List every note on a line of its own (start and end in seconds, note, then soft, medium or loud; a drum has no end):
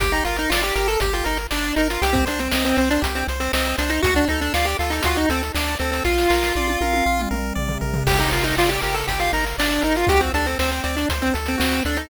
0.00 0.21 G1 loud
0.00 0.12 G4 medium
0.00 0.24 G4 loud
0.00 kick loud
0.00 closed hi-hat loud
0.12 0.24 D#4 medium
0.12 closed hi-hat medium
0.24 0.47 G1 medium
0.24 0.37 F4 medium
0.24 0.49 A#4 medium
0.24 closed hi-hat medium
0.36 0.51 D#4 medium
0.36 closed hi-hat medium
0.50 0.72 G1 medium
0.50 0.62 F4 medium
0.50 0.74 D5 medium
0.50 snare loud
0.63 0.75 G4 medium
0.63 closed hi-hat medium
0.75 0.97 G1 loud
0.75 0.88 G4 medium
0.75 0.98 A#4 medium
0.75 closed hi-hat medium
0.88 1.00 A4 medium
0.88 closed hi-hat medium
1.00 1.22 G1 loud
1.00 1.13 G4 medium
1.00 1.24 G4 medium
1.00 kick medium
1.00 closed hi-hat loud
1.13 1.26 F4 medium
1.13 closed hi-hat medium
1.24 1.47 G1 medium
1.24 1.38 D#4 medium
1.24 1.47 A#4 medium
1.24 closed hi-hat medium
1.37 closed hi-hat medium
1.51 1.73 G1 medium
1.51 1.75 D4 medium
1.51 1.73 D5 medium
1.51 snare medium
1.64 closed hi-hat medium
1.76 1.98 G1 medium
1.76 1.88 D#4 medium
1.76 2.00 A#4 medium
1.76 closed hi-hat medium
1.90 2.02 F4 medium
1.90 closed hi-hat medium
2.02 2.23 C2 loud
2.02 2.14 G4 loud
2.02 2.25 G4 loud
2.02 closed hi-hat loud
2.13 2.25 C4 medium
2.13 kick loud
2.13 closed hi-hat medium
2.26 2.48 C2 medium
2.26 2.40 D4 medium
2.26 2.48 C5 medium
2.26 closed hi-hat medium
2.39 2.52 C4 medium
2.39 closed hi-hat medium
2.51 2.74 C2 medium
2.51 2.64 C4 medium
2.51 2.75 D#5 medium
2.51 snare loud
2.65 2.77 C4 medium
2.65 closed hi-hat medium
2.77 2.99 C2 medium
2.77 2.89 C4 medium
2.77 3.00 C5 medium
2.77 closed hi-hat medium
2.90 3.02 D4 medium
2.90 closed hi-hat medium
3.02 3.24 C2 loud
3.02 3.24 G4 medium
3.02 kick medium
3.02 closed hi-hat loud
3.15 3.27 C4 medium
3.15 closed hi-hat medium
3.28 3.49 C2 medium
3.28 3.52 C5 medium
3.28 closed hi-hat medium
3.40 3.52 C4 medium
3.40 closed hi-hat medium
3.53 3.74 C2 medium
3.53 3.76 C4 medium
3.53 3.76 D#5 medium
3.53 snare loud
3.65 closed hi-hat medium
3.78 4.00 C2 loud
3.78 3.91 D4 medium
3.78 4.00 C5 medium
3.78 closed hi-hat medium
3.90 4.02 D#4 medium
3.90 closed hi-hat medium
4.02 4.25 D2 loud
4.02 4.14 F#4 loud
4.02 4.25 F#4 loud
4.02 kick loud
4.02 closed hi-hat loud
4.15 4.28 D4 medium
4.15 closed hi-hat medium
4.28 4.50 D2 medium
4.28 4.40 D#4 medium
4.28 4.53 A4 medium
4.28 closed hi-hat medium
4.41 4.53 D4 medium
4.41 closed hi-hat medium
4.54 4.75 D2 loud
4.54 4.66 F4 medium
4.54 4.77 D5 medium
4.54 snare loud
4.65 4.77 G4 medium
4.65 closed hi-hat medium
4.79 5.00 D2 medium
4.79 4.91 F4 medium
4.79 5.03 A4 medium
4.79 closed hi-hat medium
4.90 5.02 D#4 medium
4.90 closed hi-hat medium
5.03 5.26 D2 medium
5.03 5.17 F4 medium
5.03 5.27 F#4 loud
5.03 kick medium
5.03 closed hi-hat loud
5.15 5.29 D#4 medium
5.15 closed hi-hat medium
5.29 5.51 D2 medium
5.29 5.42 C4 medium
5.29 5.52 A4 medium
5.29 closed hi-hat medium
5.43 closed hi-hat medium
5.54 5.76 D2 medium
5.54 5.75 D4 medium
5.54 5.78 D5 medium
5.54 snare loud
5.68 closed hi-hat medium
5.79 6.01 D2 medium
5.79 5.91 C4 medium
5.79 6.04 A4 medium
5.79 closed hi-hat medium
5.92 6.04 C4 medium
5.92 closed hi-hat medium
6.04 6.26 A#1 loud
6.04 7.21 F4 loud
6.04 6.28 F4 loud
6.04 kick medium
6.04 snare medium
6.18 snare medium
6.30 6.52 A#1 medium
6.30 6.53 A#4 medium
6.30 snare medium
6.43 snare medium
6.55 6.77 A#1 medium
6.55 6.79 D5 medium
6.55 high tom medium
6.68 high tom medium
6.81 7.02 A#1 medium
6.81 7.04 A#4 medium
6.81 high tom medium
6.93 high tom medium
7.06 7.27 A#1 medium
7.06 7.29 F4 medium
7.20 mid tom medium
7.31 7.52 A#1 medium
7.31 7.53 A#4 medium
7.31 mid tom medium
7.55 7.78 A#1 loud
7.55 7.78 D5 medium
7.55 floor tom medium
7.68 floor tom loud
7.81 8.03 A#1 medium
7.81 8.04 A#4 medium
7.81 floor tom medium
7.94 floor tom loud
8.07 8.28 G1 loud
8.07 8.19 G4 medium
8.07 8.30 G4 loud
8.07 kick loud
8.07 crash loud
8.19 8.31 D#4 medium
8.19 closed hi-hat medium
8.31 8.53 G1 medium
8.31 8.44 F4 medium
8.31 8.55 A#4 medium
8.31 closed hi-hat medium
8.44 8.56 D#4 medium
8.44 closed hi-hat medium
8.57 8.79 G1 medium
8.57 8.70 F4 medium
8.57 8.80 D5 medium
8.57 snare loud
8.69 8.81 G4 medium
8.69 closed hi-hat medium
8.81 9.04 G1 medium
8.81 8.95 G4 medium
8.81 9.05 A#4 medium
8.81 closed hi-hat medium
8.94 9.06 A4 medium
8.94 closed hi-hat medium
9.07 9.29 G1 medium
9.07 9.19 G4 medium
9.07 9.32 G4 medium
9.07 kick medium
9.07 closed hi-hat medium
9.19 9.32 F4 medium
9.19 closed hi-hat medium
9.33 9.54 G1 medium
9.33 9.45 D#4 medium
9.33 9.57 A#4 medium
9.33 closed hi-hat medium
9.46 closed hi-hat medium
9.58 9.79 G1 medium
9.58 9.83 D4 medium
9.58 9.81 D5 medium
9.58 snare loud
9.71 closed hi-hat medium
9.82 10.05 G1 medium
9.82 9.96 D#4 medium
9.82 10.05 A#4 medium
9.82 closed hi-hat medium
9.96 10.09 F4 medium
9.96 closed hi-hat medium
10.07 10.30 D2 loud
10.07 10.31 F#4 medium
10.07 10.21 G4 loud
10.07 kick loud
10.07 closed hi-hat loud
10.20 10.32 C4 medium
10.20 closed hi-hat medium
10.34 10.55 D2 medium
10.34 10.46 D4 loud
10.34 10.57 A4 medium
10.34 closed hi-hat medium
10.46 10.58 C4 medium
10.46 closed hi-hat medium
10.59 10.80 D2 medium
10.59 10.71 C4 medium
10.59 10.82 C5 medium
10.59 snare medium
10.72 10.83 C4 medium
10.72 closed hi-hat medium
10.84 11.05 D2 medium
10.84 10.96 C4 medium
10.84 11.06 D5 medium
10.84 closed hi-hat medium
10.97 11.09 D4 medium
10.97 closed hi-hat medium
11.09 11.31 D2 medium
11.09 11.32 C5 medium
11.09 kick medium
11.09 closed hi-hat loud
11.22 11.34 C4 medium
11.22 closed hi-hat medium
11.34 11.56 D2 medium
11.34 11.56 A4 medium
11.34 closed hi-hat medium
11.46 11.59 C4 medium
11.46 closed hi-hat medium
11.58 11.81 D2 medium
11.58 11.83 C4 medium
11.58 11.80 F#4 medium
11.58 snare loud
11.72 closed hi-hat medium
11.85 12.06 D2 medium
11.85 11.98 D4 medium
11.85 12.09 A4 medium
11.85 closed hi-hat medium
11.97 12.09 D#4 medium
11.97 closed hi-hat medium